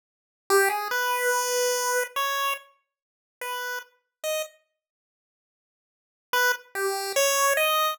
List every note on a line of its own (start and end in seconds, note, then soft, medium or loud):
0.50 0.69 G4 loud
0.69 0.88 G#4 medium
0.91 2.03 B4 medium
2.16 2.54 C#5 medium
3.41 3.79 B4 medium
4.24 4.42 D#5 medium
6.33 6.52 B4 loud
6.75 7.12 G4 medium
7.16 7.53 C#5 loud
7.57 7.94 D#5 medium